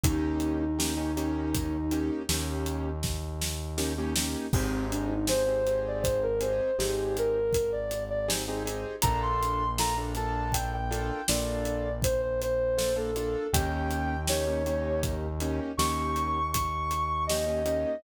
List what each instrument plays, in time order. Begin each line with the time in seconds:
0.03 synth bass 1 D#2, acoustic grand piano A#3 C#4 D#4 G4, ocarina D#4, kick, closed hi-hat
0.40 closed hi-hat
0.61 ocarina D#4
0.79 acoustic grand piano A#3 C#4 D#4 G4, snare
0.97 acoustic grand piano A#3 C#4 D#4 G4
1.17 acoustic grand piano A#3 C#4 D#4 G4, closed hi-hat
1.55 kick, closed hi-hat
1.91 acoustic grand piano A#3 C#4 D#4 G4, closed hi-hat
2.29 synth bass 1 D#2, acoustic grand piano A#3 C#4 D#4 G4, snare
2.66 closed hi-hat
3.03 kick, snare
3.42 snare
3.78 acoustic grand piano A#3 C#4 D#4 G4, snare
3.98 acoustic grand piano A#3 C#4 D#4 G4
4.16 acoustic grand piano A#3 C#4 D#4 G4, snare
4.53 synth bass 1 G#1, ocarina C4, acoustic grand piano C4 D#4 G4 G#4, kick, crash
4.91 ocarina D4, closed hi-hat
5.09 ocarina D#4
5.27 acoustic grand piano C4 D#4 G4 G#4, ocarina C5, snare
5.47 acoustic grand piano C4 D#4 G4 G#4
5.67 acoustic grand piano C4 D#4 G4 G#4, closed hi-hat
5.87 ocarina D5
6.03 ocarina C5, kick, closed hi-hat
6.23 ocarina A#4
6.41 acoustic grand piano C4 D#4 G4 G#4, ocarina C5, closed hi-hat
6.78 synth bass 1 G#1, acoustic grand piano C4 D#4 G4 G#4, ocarina G4, snare
7.17 ocarina A#4, closed hi-hat
7.53 ocarina A#4, kick, closed hi-hat
7.72 ocarina D5
7.91 closed hi-hat
8.10 ocarina D5
8.28 acoustic grand piano C4 D#4 G4 G#4, snare
8.48 acoustic grand piano C4 D#4 G4 G#4
8.65 acoustic grand piano C4 D#4 G4 G#4, closed hi-hat
9.02 synth bass 1 A#1, acoustic grand piano A#3 D4 F4 A4, ocarina A#5, kick, closed hi-hat
9.22 ocarina C6
9.43 closed hi-hat
9.78 acoustic grand piano A#3 D4 F4 A4, ocarina A#5, snare
9.98 acoustic grand piano A#3 D4 F4 A4
10.15 acoustic grand piano A#3 D4 F4 A4, ocarina A5, closed hi-hat
10.52 ocarina G5, kick, closed hi-hat
10.73 ocarina G5
10.91 acoustic grand piano A#3 D4 F4 A4, closed hi-hat
11.28 synth bass 1 A#1, acoustic grand piano A#3 D4 F4 A4, ocarina D5, snare
11.65 closed hi-hat
12.02 ocarina C5, kick, closed hi-hat
12.21 ocarina C5
12.41 ocarina C5, closed hi-hat
12.78 acoustic grand piano A#3 D4 F4 A4, snare
12.96 acoustic grand piano A#3 D4 F4 A4, ocarina A4
13.16 acoustic grand piano A#3 D4 F4 A4, closed hi-hat
13.53 synth bass 1 D#2, acoustic grand piano A#3 C#4 D#4 G4, ocarina G5, kick, closed hi-hat
13.91 closed hi-hat
14.28 acoustic grand piano A#3 C#4 D#4 G4, ocarina C#5, snare
14.47 acoustic grand piano A#3 C#4 D#4 G4
14.66 acoustic grand piano A#3 C#4 D#4 G4, closed hi-hat
15.03 kick, closed hi-hat
15.40 acoustic grand piano A#3 C#4 D#4 G4, closed hi-hat
15.77 synth bass 1 D#2, acoustic grand piano A#3 C#4 D#4 G4, ocarina C#6, snare
16.16 closed hi-hat
16.52 ocarina C#6, kick, closed hi-hat
16.91 closed hi-hat
17.27 acoustic grand piano A#3 C#4 D#4 G4, ocarina D#5, snare
17.47 acoustic grand piano A#3 C#4 D#4 G4
17.66 acoustic grand piano A#3 C#4 D#4 G4, closed hi-hat